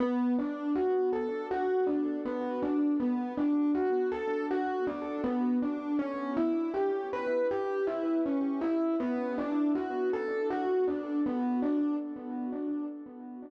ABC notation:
X:1
M:4/4
L:1/8
Q:1/4=80
K:Bm
V:1 name="Electric Piano 1"
B, D F A F D B, D | B, D F A F D B, D | C E G B G E C E | B, D F A F D B, D |]